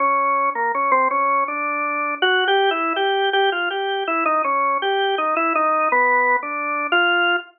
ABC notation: X:1
M:2/4
L:1/16
Q:1/4=81
K:none
V:1 name="Drawbar Organ"
_D3 _B, D C D2 | D4 (3_G2 =G2 E2 | G2 G F G2 E _E | _D2 G2 _E =E _E2 |
(3B,4 D4 F4 |]